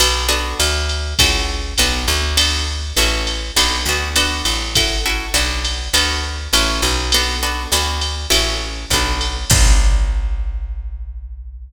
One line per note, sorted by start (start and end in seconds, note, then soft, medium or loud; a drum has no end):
0.00 0.54 B1 loud
0.00 0.27 B3 loud
0.00 0.27 D4 loud
0.00 0.27 F#4 loud
0.00 0.27 A4 loud
0.00 ride loud
0.29 1.00 B3 loud
0.29 1.00 D4 loud
0.29 1.00 F#4 loud
0.29 1.00 A4 loud
0.60 1.14 D2 loud
0.60 hi-hat pedal medium
0.60 ride medium
0.89 ride medium
1.19 1.74 C#2 loud
1.19 1.62 C#4 medium
1.19 1.62 E4 loud
1.19 1.62 F#4 loud
1.19 1.62 A4 loud
1.19 kick medium
1.19 ride loud
1.78 2.06 B1 medium
1.78 2.21 B3 loud
1.78 2.21 D4 loud
1.78 2.21 F#4 loud
1.78 2.21 A4 loud
1.78 hi-hat pedal medium
1.78 ride medium
2.08 2.92 D2 loud
2.08 ride medium
2.37 2.79 B3 loud
2.37 2.79 D4 loud
2.37 2.79 F#4 loud
2.37 2.79 A4 loud
2.37 ride loud
2.97 3.51 A1 loud
2.97 3.40 C#4 loud
2.97 3.40 E4 loud
2.97 3.40 F#4 loud
2.97 3.40 A4 loud
2.97 hi-hat pedal medium
2.97 ride medium
3.27 ride medium
3.56 3.85 B1 medium
3.56 3.77 B3 loud
3.56 3.77 D4 loud
3.56 3.77 F#4 loud
3.56 3.77 A4 loud
3.56 ride loud
3.86 4.42 D2 medium
3.86 4.09 B3 loud
3.86 4.09 D4 medium
3.86 4.09 F#4 medium
3.86 4.09 A4 medium
4.16 4.58 B3 loud
4.16 4.58 D4 loud
4.16 4.58 F#4 loud
4.16 4.58 A4 loud
4.16 hi-hat pedal medium
4.16 ride medium
4.45 5.29 A1 medium
4.45 ride medium
4.75 4.97 C#4 medium
4.75 4.97 E4 loud
4.75 4.97 F#4 loud
4.75 4.97 A4 loud
4.75 kick medium
4.75 ride loud
5.06 5.26 C#4 medium
5.06 5.26 E4 medium
5.06 5.26 F#4 medium
5.06 5.26 A4 medium
5.34 5.89 B1 medium
5.34 5.75 B3 loud
5.34 5.75 D4 loud
5.34 5.75 F#4 loud
5.34 5.75 A4 loud
5.34 hi-hat pedal medium
5.34 ride medium
5.65 ride medium
5.93 6.48 D2 medium
5.93 6.35 B3 loud
5.93 6.35 D4 loud
5.93 6.35 F#4 loud
5.93 6.35 A4 loud
5.93 ride loud
6.53 6.81 A1 loud
6.53 6.95 C#4 loud
6.53 6.95 E4 loud
6.53 6.95 F#4 loud
6.53 6.95 A4 loud
6.53 hi-hat pedal medium
6.53 ride medium
6.82 7.67 B1 loud
6.82 ride medium
7.12 7.35 B3 loud
7.12 7.35 D4 loud
7.12 7.35 F#4 loud
7.12 7.35 A4 loud
7.12 ride loud
7.43 7.63 B3 medium
7.43 7.63 D4 medium
7.43 7.63 F#4 medium
7.43 7.63 A4 medium
7.72 8.26 D2 medium
7.72 8.14 B3 loud
7.72 8.14 D4 loud
7.72 8.14 F#4 loud
7.72 8.14 A4 loud
7.72 hi-hat pedal medium
7.72 ride medium
8.01 ride medium
8.30 8.86 A1 medium
8.30 8.72 C#4 loud
8.30 8.72 E4 loud
8.30 8.72 F#4 loud
8.30 8.72 A4 loud
8.30 ride loud
8.90 9.45 B1 medium
8.90 9.35 B3 loud
8.90 9.35 D4 loud
8.90 9.35 F#4 loud
8.90 9.35 A4 medium
8.90 kick medium
8.90 hi-hat pedal medium
8.90 ride medium
9.21 ride medium
9.50 11.68 B1 loud
9.50 11.69 B3 loud
9.50 11.69 D4 loud
9.50 11.69 F#4 medium
9.50 11.69 A4 loud
9.50 kick loud
9.50 crash loud